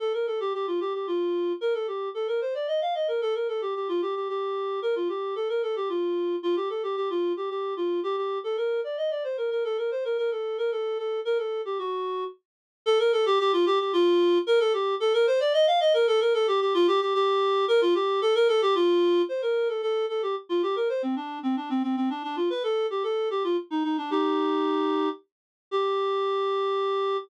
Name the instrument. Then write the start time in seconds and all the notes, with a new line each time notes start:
clarinet
0.00 A4
0.14 A#4
0.27 A4
0.40 G4
0.54 G4
0.67 F4
0.80 G4
0.94 G4
1.07 F4
1.61 A#4
1.74 A4
1.87 G4
2.14 A4
2.28 A#4
2.41 C5
2.54 D5
2.68 D#5
2.81 F5
2.95 D#5
3.08 A#4
3.22 A4
3.35 A#4
3.48 A4
3.61 G4
3.75 G4
3.89 F4
4.02 G4
4.15 G4
4.29 G4
4.82 A#4
4.96 F4
5.09 G4
5.35 A4
5.49 A#4
5.63 A4
5.76 G4
5.89 F4
6.43 F4
6.56 G4
6.70 A4
6.83 G4
6.96 G4
7.10 F4
7.37 G4
7.50 G4
7.77 F4
8.03 G4
8.17 G4
8.44 A4
8.57 A#4
8.84 D5
8.97 D#5
9.11 D5
9.24 C5
9.37 A#4
9.51 A#4
9.64 A4
9.78 A#4
9.91 C5
10.05 A#4
10.18 A#4
10.31 A4
10.58 A#4
10.72 A4
10.98 A4
11.25 A#4
11.38 A4
11.65 G4
11.79 F#4
12.86 A4
12.99 A#4
13.12 A4
13.26 G4
13.39 G4
13.53 F4
13.66 G4
13.80 G4
13.93 F4
14.47 A#4
14.60 A4
14.73 G4
15.00 A4
15.14 A#4
15.27 C5
15.40 D5
15.53 D#5
15.67 F5
15.80 D#5
15.94 A#4
16.07 A4
16.21 A#4
16.34 A4
16.47 G4
16.61 G4
16.74 F4
16.87 G4
17.01 G4
17.14 G4
17.68 A#4
17.81 F4
17.95 G4
18.22 A4
18.35 A#4
18.48 A4
18.62 G4
18.75 F4
19.29 C5
19.42 A#4
19.69 A4
19.82 A4
20.09 A4
20.22 G4
20.49 F4
20.63 G4
20.76 A#4
20.89 C5
21.03 C4
21.16 D4
21.43 C4
21.56 D4
21.70 C4
21.83 C4
21.97 C4
22.10 D4
22.23 D4
22.36 F4
22.50 B4
22.63 A4
22.90 G4
23.03 A4
23.30 G4
23.44 F4
23.71 D#4
23.84 D#4
23.98 D4
24.11 D#4 G4
25.71 G4